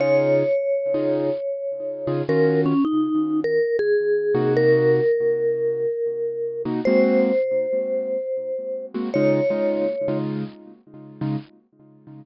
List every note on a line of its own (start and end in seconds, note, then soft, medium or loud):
0.00 0.43 C#3 medium
0.00 0.43 D#4 medium
0.00 0.43 F4 medium
0.00 0.43 G#4 medium
0.00 2.22 C#5 loud
0.94 1.30 C#3 medium
0.94 1.30 D#4 medium
0.94 1.30 F4 medium
0.94 1.30 G#4 medium
2.07 2.22 C#3 medium
2.07 2.22 D#4 medium
2.07 2.22 F4 medium
2.07 2.22 G#4 medium
2.29 2.73 D#3 medium
2.29 2.73 C#4 loud
2.29 2.73 F4 medium
2.29 2.73 F#4 medium
2.29 2.61 A#4 loud
2.66 2.84 C#4 loud
2.85 3.40 D#4 loud
3.44 3.77 A#4 loud
3.79 4.54 G#4 loud
4.35 5.00 C3 medium
4.35 5.00 A#3 medium
4.35 5.00 D#4 medium
4.35 5.00 F#4 loud
4.57 6.62 A#4 loud
6.65 6.80 C3 medium
6.65 6.80 A#3 medium
6.65 6.80 D#4 medium
6.65 6.80 F#4 medium
6.85 7.31 G#3 medium
6.85 7.31 A#3 medium
6.85 7.31 C4 medium
6.85 7.31 F#4 medium
6.85 8.86 C5 loud
8.94 9.09 G#3 medium
8.94 9.09 A#3 medium
8.94 9.09 C4 medium
8.94 9.09 F#4 medium
9.14 9.40 C#3 medium
9.14 9.40 G#3 medium
9.14 9.40 D#4 loud
9.14 9.40 F4 medium
9.14 10.17 C#5 loud
9.50 9.86 C#3 medium
9.50 9.86 G#3 medium
9.50 9.86 D#4 medium
9.50 9.86 F4 medium
10.08 10.44 C#3 medium
10.08 10.44 G#3 medium
10.08 10.44 D#4 medium
10.08 10.44 F4 medium
11.21 11.36 C#3 medium
11.21 11.36 G#3 medium
11.21 11.36 D#4 medium
11.21 11.36 F4 medium